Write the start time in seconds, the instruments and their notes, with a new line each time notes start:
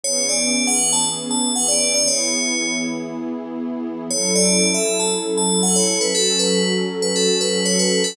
0.03 pad 5 (bowed) E3 B3 C#4 G#4, tubular bells C#5
0.29 tubular bells D5
0.67 tubular bells F#5
0.93 tubular bells A5
1.31 tubular bells A5
1.56 tubular bells F#5
1.68 tubular bells D5
1.94 tubular bells D5
2.07 pad 5 (bowed) E3 B3 E4 G#4, tubular bells C#5
4.10 pad 5 (bowed) F#3 C#4 E4 A4, tubular bells C#5
4.35 tubular bells D5
4.74 tubular bells E5
5.00 tubular bells A5
5.38 tubular bells A5
5.63 tubular bells F#5
5.76 tubular bells C#5
6.01 tubular bells B4
6.14 pad 5 (bowed) F#3 C#4 F#4 A4, tubular bells A4
6.39 tubular bells B4
7.02 tubular bells B4
7.16 tubular bells A4
7.41 tubular bells B4
7.66 tubular bells C#5
7.79 tubular bells B4
8.04 tubular bells A4